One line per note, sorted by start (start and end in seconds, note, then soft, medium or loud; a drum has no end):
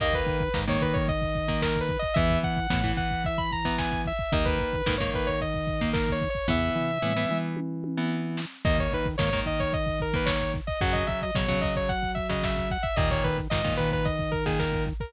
0.00 0.23 D#2 medium
0.00 0.43 D#3 loud
0.00 0.43 A#3 loud
0.00 0.14 D#5 loud
0.00 kick loud
0.00 crash loud
0.13 0.59 B4 medium
0.13 kick medium
0.26 0.49 D#3 medium
0.26 kick medium
0.26 closed hi-hat medium
0.40 kick medium
0.54 0.78 G#2 medium
0.54 0.65 D#3 loud
0.54 0.65 A#3 medium
0.54 kick medium
0.54 snare loud
0.68 1.11 D#3 loud
0.68 1.11 A#3 loud
0.68 0.82 C#5 medium
0.68 kick medium
0.81 1.97 D#3 medium
0.81 0.95 B4 medium
0.81 kick medium
0.81 closed hi-hat medium
0.93 1.06 C#5 medium
0.93 kick loud
1.08 1.60 D#5 medium
1.08 kick medium
1.08 closed hi-hat medium
1.22 kick medium
1.35 kick medium
1.35 closed hi-hat medium
1.48 1.92 D#3 loud
1.48 1.92 A#3 loud
1.48 kick medium
1.62 1.79 A#4 medium
1.62 kick medium
1.62 snare loud
1.76 kick medium
1.81 1.98 B4 medium
1.89 kick medium
1.89 closed hi-hat medium
1.99 2.16 D#5 loud
1.99 kick medium
2.14 2.39 E2 medium
2.14 2.60 E3 loud
2.14 2.60 B3 loud
2.14 2.39 E5 loud
2.14 kick loud
2.14 closed hi-hat loud
2.30 kick medium
2.43 2.67 E3 medium
2.43 2.91 F#5 medium
2.43 kick medium
2.43 closed hi-hat medium
2.57 kick medium
2.70 2.93 A2 medium
2.70 2.81 E3 loud
2.70 2.81 B3 loud
2.70 kick loud
2.70 snare loud
2.83 3.27 E3 medium
2.83 3.27 B3 medium
2.83 kick medium
2.97 4.12 E3 medium
2.97 3.23 F#5 medium
2.97 kick medium
2.97 closed hi-hat medium
3.11 kick medium
3.24 3.39 E5 medium
3.24 kick medium
3.24 closed hi-hat loud
3.38 3.51 B5 medium
3.38 kick medium
3.52 3.76 A#5 medium
3.52 kick medium
3.52 closed hi-hat medium
3.65 4.08 E3 loud
3.65 4.08 B3 medium
3.65 kick medium
3.78 4.01 G#5 medium
3.78 kick medium
3.78 snare loud
3.92 kick medium
4.05 4.33 E5 medium
4.05 kick medium
4.05 closed hi-hat medium
4.19 kick medium
4.32 4.56 D#2 medium
4.32 4.76 D#3 loud
4.32 4.76 A#3 loud
4.32 4.45 D#5 medium
4.32 kick loud
4.32 closed hi-hat loud
4.45 4.95 B4 medium
4.45 kick medium
4.59 4.82 D#3 medium
4.59 kick medium
4.59 closed hi-hat medium
4.73 kick medium
4.86 5.10 G#2 medium
4.86 4.97 D#3 loud
4.86 4.97 A#3 loud
4.86 kick medium
4.86 snare loud
4.98 5.44 D#3 loud
4.98 5.44 A#3 loud
4.98 5.11 C#5 medium
4.98 kick medium
5.13 6.28 D#3 medium
5.13 5.28 B4 medium
5.13 kick medium
5.13 closed hi-hat medium
5.27 5.40 C#5 medium
5.27 kick medium
5.41 5.90 D#5 medium
5.41 kick medium
5.41 closed hi-hat medium
5.54 kick medium
5.67 kick medium
5.67 closed hi-hat medium
5.81 6.25 D#3 medium
5.81 6.25 A#3 loud
5.81 kick medium
5.93 6.10 A#4 medium
5.93 kick medium
5.93 snare loud
6.08 6.29 C#5 medium
6.08 kick medium
6.21 kick medium
6.21 closed hi-hat medium
6.30 6.47 C#5 medium
6.35 kick medium
6.48 6.70 E2 loud
6.48 6.91 E3 loud
6.48 6.91 B3 loud
6.48 7.38 E5 loud
6.48 kick medium
6.48 floor tom medium
6.76 6.98 E3 medium
6.76 floor tom medium
7.02 7.26 A2 medium
7.02 7.13 E3 loud
7.02 7.13 B3 medium
7.02 mid tom medium
7.17 7.60 E3 loud
7.17 7.60 B3 medium
7.29 8.45 E3 medium
7.29 mid tom medium
7.57 high tom medium
7.84 high tom medium
7.97 8.41 E3 loud
7.97 8.41 B3 medium
8.37 snare loud
8.65 8.88 D#2 medium
8.65 9.08 D#3 loud
8.65 9.08 A#3 loud
8.65 8.78 D#5 loud
8.65 kick loud
8.65 crash loud
8.78 8.93 C#5 medium
8.78 kick medium
8.92 9.16 D#3 medium
8.92 9.07 B4 medium
8.92 kick medium
8.92 closed hi-hat medium
9.06 kick medium
9.18 9.42 G#2 medium
9.18 9.30 D#3 loud
9.18 9.30 A#3 loud
9.18 9.39 C#5 medium
9.18 kick medium
9.18 snare loud
9.32 9.76 D#3 medium
9.32 9.76 A#3 loud
9.32 kick medium
9.46 10.61 D#3 medium
9.46 9.60 D#5 medium
9.46 kick medium
9.46 closed hi-hat medium
9.60 9.73 C#5 medium
9.60 kick medium
9.73 9.99 D#5 medium
9.73 kick medium
9.73 closed hi-hat medium
9.87 kick medium
10.00 10.15 A#4 medium
10.00 kick medium
10.00 closed hi-hat medium
10.14 10.57 D#3 loud
10.14 10.57 A#3 loud
10.14 10.28 B4 medium
10.14 kick medium
10.26 10.52 C#5 medium
10.26 kick medium
10.26 snare loud
10.40 kick medium
10.54 kick medium
10.54 closed hi-hat medium
10.67 10.80 D#5 medium
10.67 kick medium
10.81 11.04 F#2 medium
10.81 11.24 C#3 loud
10.81 11.24 F#3 loud
10.81 10.94 F#5 loud
10.81 kick loud
10.81 closed hi-hat loud
10.93 11.06 D#5 medium
10.93 kick medium
11.07 11.31 F#3 medium
11.07 11.20 E5 medium
11.07 kick medium
11.07 closed hi-hat medium
11.22 11.35 D#5 medium
11.22 kick medium
11.35 11.58 B2 medium
11.35 11.47 C#3 loud
11.35 11.47 F#3 loud
11.35 11.60 C#5 medium
11.35 kick medium
11.35 snare loud
11.48 11.92 C#3 loud
11.48 11.92 F#3 loud
11.48 kick medium
11.61 12.78 F#3 medium
11.61 11.74 D#5 medium
11.61 kick medium
11.61 closed hi-hat medium
11.76 11.89 C#5 medium
11.76 kick medium
11.89 12.11 F#5 medium
11.89 kick medium
11.89 closed hi-hat medium
12.03 kick medium
12.15 12.27 E5 medium
12.15 kick medium
12.15 closed hi-hat medium
12.29 12.73 C#3 medium
12.29 12.73 F#3 loud
12.29 12.43 D#5 medium
12.29 kick medium
12.43 12.69 E5 medium
12.43 kick medium
12.43 snare loud
12.57 kick medium
12.70 12.84 F#5 medium
12.70 kick medium
12.70 closed hi-hat medium
12.83 12.95 E5 medium
12.83 kick medium
12.96 13.20 D#2 medium
12.96 13.40 A#2 loud
12.96 13.40 D#3 loud
12.96 13.09 D#5 loud
12.96 kick loud
12.96 closed hi-hat loud
13.11 13.24 C#5 medium
13.11 kick medium
13.24 13.48 D#3 medium
13.24 13.37 B4 medium
13.24 kick medium
13.24 closed hi-hat medium
13.38 kick medium
13.50 13.74 G#2 medium
13.50 13.62 A#2 loud
13.50 13.62 D#3 medium
13.50 13.74 D#5 medium
13.50 kick medium
13.50 snare loud
13.64 14.08 A#2 loud
13.64 14.08 D#3 loud
13.64 kick medium
13.77 14.93 D#3 medium
13.77 13.90 B4 loud
13.77 kick medium
13.77 closed hi-hat medium
13.92 14.06 B4 medium
13.92 kick medium
14.05 14.31 D#5 medium
14.05 kick medium
14.05 closed hi-hat loud
14.19 kick medium
14.32 14.44 A#4 medium
14.32 kick medium
14.32 closed hi-hat medium
14.46 14.89 A#2 medium
14.46 14.89 D#3 loud
14.46 14.59 G#4 medium
14.46 kick medium
14.59 14.84 A#4 medium
14.59 kick medium
14.59 snare loud
14.73 kick medium
14.86 kick medium
14.86 closed hi-hat medium
15.00 15.13 A#4 medium
15.00 kick medium